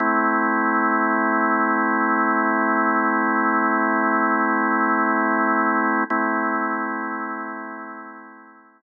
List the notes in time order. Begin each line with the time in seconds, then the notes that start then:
0.00 A3 C4 E4
6.10 A3 C4 E4